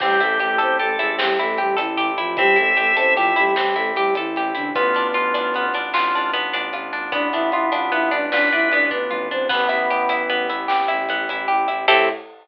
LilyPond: <<
  \new Staff \with { instrumentName = "Flute" } { \time 12/8 \key a \minor \tempo 4. = 101 <g g'>8 <a a'>8 <a a'>8 <c' c''>8 <a a'>8 <gis aes'>8 <g g'>8 <a a'>8 <g g'>8 <e e'>4 <f f'>8 | <g g'>8 <a a'>8 <a a'>8 <c' c''>8 <f f'>8 <g g'>8 <g g'>8 <a a'>8 <g g'>8 <e e'>4 <d d'>8 | <b b'>2~ <b b'>8 r2. r8 | <d' d''>8 <e' e''>8 <e' e''>8 <f' f''>8 <e' e''>8 <d' d''>8 <d' d''>8 <e' e''>8 <d' d''>8 <b b'>4 <c' c''>8 |
<b b'>2~ <b b'>8 r2. r8 | a'4. r1 r8 | }
  \new Staff \with { instrumentName = "Drawbar Organ" } { \time 12/8 \key a \minor g'2 a'4 r2. | e''2 e''4 r2. | f'4 f'2 f'4 r2 | b2. b'4. r4. |
b2 r1 | a4. r1 r8 | }
  \new Staff \with { instrumentName = "Orchestral Harp" } { \time 12/8 \key a \minor c'8 e'8 g'8 a'8 g'8 e'8 c'8 e'8 g'8 a'8 g'8 e'8 | c'8 e'8 g'8 a'8 g'8 e'8 c'8 e'8 g'8 a'8 g'8 e'8 | b8 d'8 f'8 d'8 b8 d'8 f'8 d'8 b8 d'8 f'8 d'8 | b8 d'8 f'8 d'8 b8 d'8 f'8 d'8 b8 d'8 f'8 d'8 |
b8 e'8 g'8 e'8 b8 e'8 g'8 e'8 b8 e'8 g'8 e'8 | <c' e' g' a'>4. r1 r8 | }
  \new Staff \with { instrumentName = "Violin" } { \clef bass \time 12/8 \key a \minor a,,8 a,,8 a,,8 a,,8 a,,8 a,,8 a,,8 a,,8 a,,8 a,,8 a,,8 a,,8 | a,,8 a,,8 a,,8 a,,8 a,,8 a,,8 a,,8 a,,8 a,,8 a,,8 a,,8 a,,8 | a,,8 a,,8 a,,8 a,,8 a,,8 a,,8 a,,8 a,,8 a,,8 a,,8 a,,8 a,,8 | a,,8 a,,8 a,,8 a,,8 a,,8 a,,8 a,,8 a,,8 a,,8 a,,8 a,,8 a,,8 |
a,,8 a,,8 a,,8 a,,8 a,,8 a,,8 a,,8 a,,8 a,,8 a,,8 a,,8 a,,8 | a,4. r1 r8 | }
  \new Staff \with { instrumentName = "Brass Section" } { \time 12/8 \key a \minor <c' e' g' a'>1.~ | <c' e' g' a'>1. | <b d' f'>1.~ | <b d' f'>1. |
<b e' g'>1. | <c' e' g' a'>4. r1 r8 | }
  \new DrumStaff \with { instrumentName = "Drums" } \drummode { \time 12/8 <cymc bd>8 hh8 hh8 hh8 hh8 hh8 sn8 hh8 hh8 hh8 hh8 hh8 | <hh bd>8 hh8 hh8 hh8 hh8 hh8 sn8 hh8 hh8 hh8 hh8 hh8 | <hh bd>8 hh8 hh8 hh8 hh8 hh8 sn8 hh8 hh8 hh8 hh8 hh8 | <hh bd>8 hh8 hh8 hh8 hh8 hh8 sn8 hh8 hh8 <bd tomfh>8 toml4 |
<cymc bd>8 hh8 hh8 hh8 hh8 hh8 sn8 hh8 hh8 hh8 hh8 hh8 | <cymc bd>4. r4. r4. r4. | }
>>